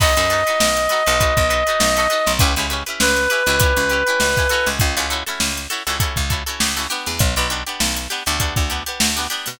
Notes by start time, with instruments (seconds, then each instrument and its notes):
0.00 electric bass (finger) B1, acoustic guitar (steel) D#4 F#4 A4 B4, clarinet D#5, kick, crash
0.17 electric bass (finger) F#2, acoustic guitar (steel) D#4 F#4 A4 B4, closed hi-hat
0.30 acoustic guitar (steel) D#4 F#4 A4 B4, closed hi-hat
0.47 acoustic guitar (steel) D#4 F#4 A4 B4, closed hi-hat
0.60 electric bass (finger) B1, snare
0.77 closed hi-hat
0.89 acoustic guitar (steel) D#4 F#4 A4 B4, snare, closed hi-hat
1.06 electric bass (finger) B1, acoustic guitar (steel) D#4 F#4 A4 B4, closed hi-hat
1.20 acoustic guitar (steel) D#4 F#4 A4 B4, kick, closed hi-hat
1.37 electric bass (finger) B1, kick, closed hi-hat
1.50 acoustic guitar (steel) D#4 F#4 A4 B4, closed hi-hat
1.67 acoustic guitar (steel) D#4 F#4 A4 B4, closed hi-hat
1.80 electric bass (finger) B1, snare
1.97 acoustic guitar (steel) D#4 F#4 A4 B4, closed hi-hat
2.10 acoustic guitar (steel) D#4 F#4 A4 B4, closed hi-hat
2.27 electric bass (finger) B1, snare, closed hi-hat
2.39 electric bass (finger) C#2, acoustic guitar (steel) C#4 E4 G4 B4, kick, closed hi-hat
2.56 electric bass (finger) C#2, acoustic guitar (steel) C#4 E4 G4 B4, snare, closed hi-hat
2.70 acoustic guitar (steel) C#4 E4 G4 B4, closed hi-hat
2.86 acoustic guitar (steel) C#4 E4 G4 B4, closed hi-hat
3.00 electric bass (finger) C#2, clarinet B4, snare
3.17 closed hi-hat
3.30 acoustic guitar (steel) C#4 E4 G4 B4, closed hi-hat
3.46 electric bass (finger) C#2, acoustic guitar (steel) C#4 E4 G4 B4, closed hi-hat
3.60 acoustic guitar (steel) C#4 E4 G4 B4, kick, closed hi-hat
3.77 electric bass (finger) C#2, closed hi-hat
3.90 acoustic guitar (steel) C#4 E4 G4 B4, closed hi-hat
4.07 acoustic guitar (steel) C#4 E4 G4 B4, closed hi-hat
4.20 electric bass (finger) C#2, snare
4.37 acoustic guitar (steel) C#4 E4 G4 B4, kick, closed hi-hat
4.49 acoustic guitar (steel) C#4 E4 F#4 A4, snare, closed hi-hat
4.66 electric bass (finger) C#2, snare, closed hi-hat
4.79 electric bass (finger) C#2, kick, closed hi-hat
4.97 electric bass (finger) C#2, acoustic guitar (steel) C#4 E4 F#4 A4, closed hi-hat
5.10 acoustic guitar (steel) C#4 E4 F#4 A4, closed hi-hat
5.26 acoustic guitar (steel) C#4 E4 F#4 A4, snare, closed hi-hat
5.40 electric bass (finger) C#2, snare
5.57 closed hi-hat
5.70 acoustic guitar (steel) C#4 E4 F#4 A4, closed hi-hat
5.87 electric bass (finger) C#2, acoustic guitar (steel) C#4 E4 F#4 A4, closed hi-hat
6.00 acoustic guitar (steel) C#4 E4 F#4 A4, kick, closed hi-hat
6.16 electric bass (finger) C#2, kick, closed hi-hat
6.30 acoustic guitar (steel) C#4 E4 F#4 A4, kick, closed hi-hat
6.46 acoustic guitar (steel) C#4 E4 F#4 A4, closed hi-hat
6.60 electric bass (finger) C#2, snare
6.77 acoustic guitar (steel) C#4 E4 F#4 A4, snare, closed hi-hat
6.90 acoustic guitar (steel) B3 D4 G4, closed hi-hat
7.06 electric bass (finger) E2, snare, closed hi-hat
7.19 electric bass (finger) B1, kick, closed hi-hat
7.36 electric bass (finger) B1, acoustic guitar (steel) B3 D4 G4, closed hi-hat
7.50 acoustic guitar (steel) B3 D4 G4, closed hi-hat
7.67 acoustic guitar (steel) B3 D4 G4, closed hi-hat
7.80 electric bass (finger) B1, snare
7.96 closed hi-hat
8.10 acoustic guitar (steel) B3 D4 G4, closed hi-hat
8.26 electric bass (finger) D2, acoustic guitar (steel) B3 D4 G4, closed hi-hat
8.40 acoustic guitar (steel) B3 D4 G4, kick, closed hi-hat
8.56 electric bass (finger) D2, kick, snare, closed hi-hat
8.70 acoustic guitar (steel) B3 D4 G4, closed hi-hat
8.86 acoustic guitar (steel) B3 D4 G4, closed hi-hat
9.00 electric bass (finger) D2, snare
9.17 acoustic guitar (steel) B3 D4 G4, closed hi-hat
9.30 acoustic guitar (steel) B3 D4 G4, closed hi-hat
9.46 electric bass (finger) B2, snare, open hi-hat